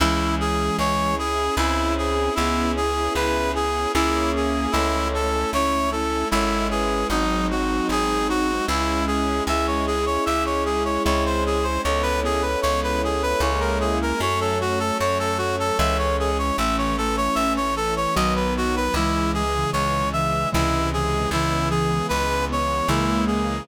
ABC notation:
X:1
M:3/4
L:1/16
Q:1/4=76
K:C#m
V:1 name="Clarinet"
E2 G2 c2 G2 E2 G2 | E2 G2 B2 G2 E2 G2 | E2 A2 c2 A2 E2 G2 | D2 F2 G2 F2 E2 G2 |
e c G c e c G c c ^B G B | c B G B c B G B c ^A G A | c A F A c A F A e c G c | e c A c e c A c d B F B |
E2 G2 c2 e2 E2 G2 | E2 G2 B2 c2 E2 G2 |]
V:2 name="Ocarina"
[E,G,]6 z6 | [EG]6 z6 | [Ac]4 [CE]2 [CE]2 [Ac]2 [GB]2 | [^B,D]8 z4 |
[EG]12 | [Ac]12 | [Ac]12 | [A,C]6 z6 |
[E,G,]3 [C,E,]3 [C,E,]2 [C,E,]2 [C,E,]2 | [C,E,]4 z8 |]
V:3 name="Acoustic Grand Piano"
C2 E2 G2 E2 [^B,CEG]4 | B,2 C2 E2 G2 [^A,CEG]4 | A,2 C2 E2 C2 [G,CE]4 | F,2 G,2 ^B,2 D2 [G,CE]4 |
G,2 C2 E2 C2 [G,^B,CE]4 | G,2 B,2 C2 E2 [G,^A,CE]4 | F,2 A,2 C2 A,2 [E,G,C]4 | E,2 A,2 C2 A,2 [D,F,B,]4 |
C,2 E,2 G,2 E,2 [^B,,C,E,G,]4 | C,2 E,2 G,2 B,2 [C,E,G,^A,]4 |]
V:4 name="Electric Bass (finger)" clef=bass
C,,4 C,,4 C,,4 | C,,4 C,,4 C,,4 | C,,4 C,,4 G,,,4 | G,,,4 G,,,4 C,,4 |
C,,4 C,,4 C,,4 | C,,4 C,,4 C,,4 | F,,4 F,,4 C,,4 | A,,,4 A,,,4 B,,,4 |
C,,4 C,,4 C,,4 | C,,4 C,,4 C,,4 |]
V:5 name="String Ensemble 1"
[CEG]8 [^B,CEG]4 | [B,CEG]8 [^A,CEG]4 | [A,CE]8 [G,CE]4 | [F,G,^B,D]8 [G,CE]4 |
[G,CE]8 [G,^B,CE]4 | [G,B,CE]8 [G,^A,CE]4 | [F,A,C]8 [E,G,C]4 | [E,A,C]8 [D,F,B,]4 |
[C,E,G,]8 [^B,,C,E,G,]4 | [C,E,G,B,]8 [C,E,G,^A,]4 |]